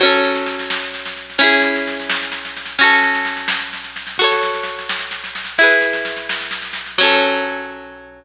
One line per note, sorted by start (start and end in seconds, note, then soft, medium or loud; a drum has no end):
0.00 1.37 F#3 medium
0.00 1.37 C#4 medium
0.00 kick loud
0.00 snare medium
0.05 1.37 A4 medium
0.12 snare medium
0.24 snare medium
0.35 snare medium
0.46 snare medium
0.59 snare medium
0.70 snare loud
0.83 snare medium
0.94 snare medium
1.06 snare medium
1.16 snare medium
1.30 snare medium
1.38 2.75 C#4 medium
1.38 2.75 E4 medium
1.38 kick loud
1.38 snare medium
1.44 2.75 G#4 medium
1.52 snare medium
1.62 snare medium
1.75 snare medium
1.87 snare medium
2.00 snare medium
2.09 snare loud
2.22 snare medium
2.32 snare medium
2.45 snare medium
2.56 snare medium
2.66 snare medium
2.79 4.15 C#4 medium
2.79 4.15 F#4 medium
2.79 kick loud
2.79 snare medium
2.84 4.15 A4 medium
2.90 snare medium
3.02 snare medium
3.15 snare medium
3.25 snare medium
3.37 snare medium
3.48 snare loud
3.60 snare medium
3.73 snare medium
3.84 snare medium
3.96 snare medium
4.07 snare medium
4.18 5.56 F#4 medium
4.18 5.56 A4 medium
4.18 kick loud
4.18 snare medium
4.24 5.56 C#5 medium
4.31 snare medium
4.43 snare medium
4.54 snare medium
4.63 snare medium
4.79 snare medium
4.89 snare loud
4.99 snare medium
5.11 snare medium
5.24 snare medium
5.35 snare medium
5.45 snare medium
5.58 6.95 E4 medium
5.58 6.95 G#4 medium
5.58 kick loud
5.58 snare medium
5.64 6.95 B4 medium
5.70 snare medium
5.81 snare medium
5.93 snare medium
6.05 snare medium
6.16 snare medium
6.29 snare loud
6.41 snare medium
6.51 snare medium
6.62 snare medium
6.73 snare medium
6.86 snare medium
6.98 8.24 F#3 loud
6.98 8.24 C#4 loud
6.98 kick loud
6.98 crash loud
7.03 8.24 A4 loud